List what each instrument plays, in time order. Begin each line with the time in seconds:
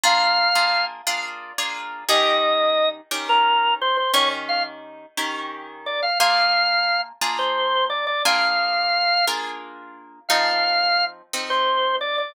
0.03 acoustic guitar (steel) A#3 D4 F4 G#4, drawbar organ F5
0.55 acoustic guitar (steel) A#3 D4 F4 G#4
1.07 acoustic guitar (steel) A#3 D4 F4 G#4
1.58 acoustic guitar (steel) A#3 D4 F4 G#4
2.09 acoustic guitar (steel) D#3 C#4 G4 A#4, drawbar organ D#5
3.11 acoustic guitar (steel) D#3 C#4 G4 A#4
3.29 drawbar organ A#4
3.81 drawbar organ C5
3.97 drawbar organ C5
4.14 acoustic guitar (steel) D#3 C#4 G4 A#4, drawbar organ C#5
4.49 drawbar organ F5
5.17 acoustic guitar (steel) D#3 C#4 G4 A#4
5.86 drawbar organ D5
6.02 drawbar organ F5
6.20 acoustic guitar (steel) A#3 D4 F4 G#4, drawbar organ F5
7.21 acoustic guitar (steel) A#3 D4 F4 G#4
7.39 drawbar organ C5
7.90 drawbar organ D5
8.07 drawbar organ D5
8.25 acoustic guitar (steel) A#3 D4 F4 G#4, drawbar organ F5
9.27 acoustic guitar (steel) A#3 D4 F4 G#4
10.29 acoustic guitar (steel) F3 C4 D#4 A4, drawbar organ F5
11.33 acoustic guitar (steel) F3 C4 D#4 A4
11.50 drawbar organ C5
12.01 drawbar organ D5
12.18 drawbar organ D5